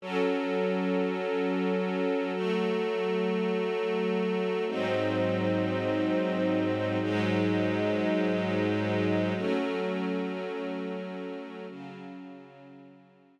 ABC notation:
X:1
M:3/4
L:1/8
Q:1/4=77
K:F#phr
V:1 name="String Ensemble 1"
[F,CA]6 | [F,A,A]6 | [^G,,F,^B,^D]6 | [^G,,F,^G,^D]6 |
[F,A,C]6 | [C,F,C]6 |]